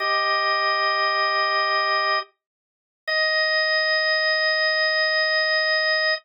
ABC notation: X:1
M:4/4
L:1/8
Q:1/4=78
K:Eb
V:1 name="Drawbar Organ"
[Ge]6 z2 | e8 |]